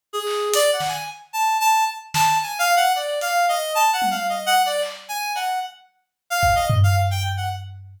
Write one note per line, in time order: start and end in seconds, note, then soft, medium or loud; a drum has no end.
0.13 0.49 G#4 medium
0.27 clap medium
0.54 0.71 D5 loud
0.54 closed hi-hat medium
0.73 0.89 F#5 medium
0.80 snare medium
0.88 1.04 G#5 medium
1.33 1.57 A5 medium
1.60 1.84 A5 loud
2.14 2.38 A5 medium
2.14 snare medium
2.43 2.59 G#5 medium
2.59 2.75 F5 loud
2.76 2.92 F#5 loud
2.95 3.19 D5 medium
3.21 3.46 F5 medium
3.21 closed hi-hat medium
3.49 3.73 D#5 medium
3.75 3.91 A5 loud
3.93 4.09 F#5 medium
4.02 high tom medium
4.11 4.27 F5 medium
4.29 4.46 D#5 medium
4.46 4.62 F#5 loud
4.66 4.82 D5 medium
4.82 clap medium
5.09 5.33 G#5 medium
5.35 5.59 F#5 medium
5.35 cowbell soft
6.30 6.54 F5 loud
6.43 kick medium
6.55 6.68 D#5 medium
6.70 floor tom loud
6.83 6.96 F5 loud
7.11 7.23 G5 medium
7.37 7.49 F#5 soft